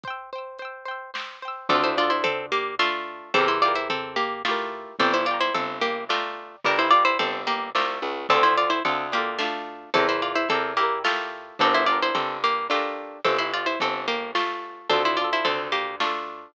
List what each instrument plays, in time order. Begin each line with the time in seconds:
0.04 orchestral harp C5, kick, closed hi-hat
0.08 orchestral harp G5 E6
0.33 orchestral harp C5 G5
0.38 orchestral harp E6
0.59 orchestral harp C5 G5, closed hi-hat
0.65 orchestral harp E6
0.85 orchestral harp C5 G5
0.91 orchestral harp E6
1.14 orchestral harp C5 G5, snare
1.19 orchestral harp E6
1.42 orchestral harp C5 G5
1.48 orchestral harp E6
1.69 electric bass (finger) D2, pizzicato strings C4 A4, orchestral harp D4 F4, kick, floor tom
1.75 orchestral harp A4
1.84 pizzicato strings E4 C5
1.97 orchestral harp D4 F4, pizzicato strings F4 D5
2.03 orchestral harp A4
2.10 pizzicato strings E4 C5
2.24 pizzicato strings C4 A4, floor tom
2.52 pizzicato strings A#3 G4
2.79 pizzicato strings A3 F4, orchestral harp D4 F4, snare
2.85 orchestral harp A4
3.34 electric bass (finger) E2, pizzicato strings C4 A4, orchestral harp E4, kick, floor tom
3.38 orchestral harp G4 A#4
3.48 pizzicato strings E4 C5
3.62 orchestral harp E4 G4, pizzicato strings F4 D5
3.68 orchestral harp A#4
3.75 pizzicato strings E4 C5
3.89 pizzicato strings C4 A4, floor tom
4.16 pizzicato strings A#3 G4
4.45 pizzicato strings A3 F4, orchestral harp E4 G4, snare
4.51 orchestral harp A#4
4.99 electric bass (finger) G1, pizzicato strings C4 A4, orchestral harp D5, kick, floor tom
5.03 orchestral harp G5 A#5
5.14 pizzicato strings E4 C5
5.26 pizzicato strings F4 D5, orchestral harp D5
5.31 orchestral harp G5 A#5
5.40 pizzicato strings E4 C5
5.54 electric bass (finger) G1, pizzicato strings C4 A4, floor tom
5.81 pizzicato strings A#3 G4
6.09 pizzicato strings A3 F4, orchestral harp D5 G5, snare
6.15 orchestral harp A#5
6.64 electric bass (finger) G1, pizzicato strings D4 A#4, orchestral harp D5 G5, kick, floor tom
6.71 orchestral harp A#5
6.79 pizzicato strings E4 C5
6.91 pizzicato strings F4 D5, orchestral harp D5
6.96 orchestral harp G5 A#5
7.05 pizzicato strings E4 C5
7.19 electric bass (finger) G1, pizzicato strings C4 A4, floor tom
7.47 pizzicato strings A#3 G4
7.75 electric bass (finger) C2, pizzicato strings A3 F4, orchestral harp D5 G5, snare
7.80 orchestral harp A#5
8.02 electric bass (finger) C#2
8.29 electric bass (finger) D2, pizzicato strings C4 A4, orchestral harp D4 F4, kick, floor tom
8.35 orchestral harp A4
8.43 pizzicato strings E4 C5
8.57 pizzicato strings F4 D5
8.70 pizzicato strings E4 C5
8.85 electric bass (finger) D2, pizzicato strings C4 A4, orchestral harp D4 F4, floor tom
8.91 orchestral harp A4
9.12 pizzicato strings A#3 G4, orchestral harp D4 F4
9.18 orchestral harp A4
9.39 pizzicato strings A3 F4, orchestral harp D4 F4, snare
9.45 orchestral harp A4
9.94 electric bass (finger) E2, pizzicato strings C4 A4, orchestral harp E4 G4, kick, floor tom
10.00 orchestral harp A#4
10.09 pizzicato strings E4 C5
10.22 pizzicato strings F4 D5
10.35 pizzicato strings E4 C5
10.49 electric bass (finger) E2, pizzicato strings C4 A4, orchestral harp E4 G4, floor tom
10.54 orchestral harp A#4
10.77 pizzicato strings A#3 G4, orchestral harp E4 G4
10.83 orchestral harp A#4
11.04 pizzicato strings A3 F4, orchestral harp E4 G4, snare
11.10 orchestral harp A#4
11.59 electric bass (finger) G1, pizzicato strings C4 A4, orchestral harp D4 G4, kick, floor tom
11.65 orchestral harp A#4
11.74 pizzicato strings E4 C5
11.86 orchestral harp D4 G4, pizzicato strings F4 D5
11.92 orchestral harp A#4
12.02 pizzicato strings E4 C5
12.15 electric bass (finger) G1, pizzicato strings C4 A4, floor tom
12.44 pizzicato strings A#3 G4
12.70 pizzicato strings A3 F4, orchestral harp D4 G4, snare
12.75 orchestral harp A#4
13.25 electric bass (finger) G1, pizzicato strings C4 A4, kick, floor tom
13.38 pizzicato strings E4 C5
13.54 pizzicato strings F4 D5
13.66 pizzicato strings E4 C5
13.80 electric bass (finger) G1, pizzicato strings C4 A4, floor tom
14.08 pizzicato strings A#3 G4
14.35 pizzicato strings A3 F4, snare
14.90 electric bass (finger) D2, pizzicato strings C4 A4, orchestral harp D4 F4, kick, floor tom
14.96 orchestral harp A4
15.05 pizzicato strings E4 C5
15.17 orchestral harp D4, pizzicato strings F4 D5
15.21 orchestral harp F4 A4
15.33 pizzicato strings E4 C5
15.45 electric bass (finger) D2, pizzicato strings C4 A4, floor tom
15.72 pizzicato strings A#3 G4
16.00 pizzicato strings A3 F4, orchestral harp D4 F4, snare
16.06 orchestral harp A4